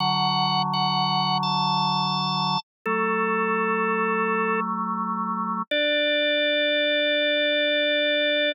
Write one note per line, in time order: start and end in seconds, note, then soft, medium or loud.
0.00 2.58 D3 loud
0.00 2.58 F#3 loud
0.00 0.62 F#5 medium
0.74 1.38 F#5 medium
1.43 2.60 A5 medium
2.86 5.62 F#3 medium
2.86 5.62 A3 loud
2.86 4.60 A4 medium
5.71 8.52 D4 loud
5.71 8.52 D5 loud